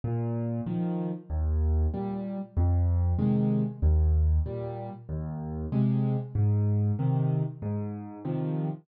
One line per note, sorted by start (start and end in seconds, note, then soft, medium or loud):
0.04 0.61 A#2 loud
0.66 1.11 D#3 loud
0.66 1.11 F3 medium
1.30 1.87 D#2 loud
1.94 2.38 A#2 medium
1.94 2.38 G3 medium
2.57 3.14 F2 loud
3.19 3.63 C3 medium
3.19 3.63 D#3 medium
3.19 3.63 G#3 medium
3.82 4.39 D#2 loud
4.46 4.90 A#2 medium
4.46 4.90 G3 medium
5.09 5.66 D#2 loud
5.72 6.16 C3 loud
5.72 6.16 G#3 loud
6.35 6.92 G#2 loud
6.99 7.43 C3 loud
6.99 7.43 D#3 medium
7.62 8.19 G#2 loud
8.25 8.69 C3 medium
8.25 8.69 D#3 medium
8.25 8.69 F3 medium